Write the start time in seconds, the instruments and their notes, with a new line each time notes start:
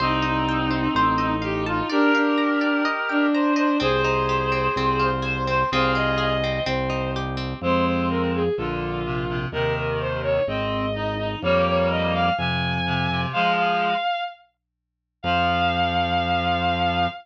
0.00 drawbar organ C2, clarinet C4 D#4, violin D#4, acoustic guitar (steel) C5
0.22 violin D#4, acoustic guitar (steel) D#5
0.49 acoustic guitar (steel) G5
0.71 acoustic guitar (steel) C5
0.95 drawbar organ A1, acoustic guitar (steel) C5
1.18 violin D#4, acoustic guitar (steel) D#5
1.42 clarinet G4, acoustic guitar (steel) F5
1.66 clarinet F4, acoustic guitar (steel) A5
1.89 violin D4, clarinet G4 A#4, acoustic guitar (steel) D5
2.14 violin D4, acoustic guitar (steel) F5
2.38 acoustic guitar (steel) A#5
2.61 acoustic guitar (steel) D5
2.85 acoustic guitar (steel) D#5
3.09 violin D4, acoustic guitar (steel) G5
3.33 clarinet C5, acoustic guitar (steel) A#5
3.56 clarinet C5, acoustic guitar (steel) D#5
3.80 drawbar organ C2, acoustic guitar (steel) C4, clarinet G#4 C5, violin C5
4.04 acoustic guitar (steel) D#4, violin C5
4.29 acoustic guitar (steel) G4
4.52 acoustic guitar (steel) C4
4.76 drawbar organ C2, acoustic guitar (steel) C4
5.00 acoustic guitar (steel) F4, violin C5
5.22 acoustic guitar (steel) G#4, clarinet C5
5.47 acoustic guitar (steel) C4, clarinet C5
5.71 drawbar organ C2, acoustic guitar (steel) C4, clarinet F4 G#4, violin C5
5.95 acoustic guitar (steel) F4, violin D#5
6.18 acoustic guitar (steel) G#4, violin D#5
6.44 acoustic guitar (steel) C4
6.66 drawbar organ C2, acoustic guitar (steel) C4, violin C5
6.90 acoustic guitar (steel) D#4
7.16 acoustic guitar (steel) G4
7.37 acoustic guitar (steel) C4
7.61 drawbar organ F2, clarinet G#3 C4, violin C5
7.86 violin C5
8.10 violin A#4
8.34 violin G#4
8.57 drawbar organ A#1, clarinet D3, violin F4
9.05 clarinet C3
9.29 clarinet C3
9.52 drawbar organ D#2, clarinet C3 D#3, violin A#4
9.76 violin A#4
10.00 violin C5
10.23 violin C#5
10.47 drawbar organ G#1, clarinet C4, violin D#5
10.95 clarinet D#4
11.19 clarinet D#4
11.42 drawbar organ F2, clarinet G3 A#3, violin C#5
11.67 violin C#5
11.90 violin D#5
12.14 violin F5
12.38 drawbar organ F2, clarinet C3, violin G#5
12.86 clarinet C3
13.10 clarinet C3
13.33 clarinet F3 G#3, violin F5
13.56 violin F5
15.23 drawbar organ F2, clarinet F3, violin F5